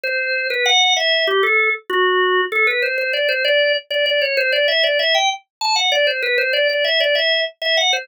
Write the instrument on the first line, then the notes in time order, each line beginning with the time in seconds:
drawbar organ
0.03 C5
0.50 B4
0.66 F#5
0.97 E5
1.27 G4
1.43 A4
1.90 F#4
2.52 A4
2.67 B4
2.82 C5
2.98 C5
3.13 D5
3.29 C5
3.44 D5
3.90 D5
4.06 D5
4.22 C#5
4.37 C5
4.52 D5
4.68 E5
4.83 D5
4.99 E5
5.15 G5
5.61 A5
5.76 F#5
5.92 D5
6.07 C5
6.22 B4
6.38 C5
6.53 D5
6.69 D5
6.84 E5
7.00 D5
7.15 E5
7.62 E5
7.77 F#5
7.93 C5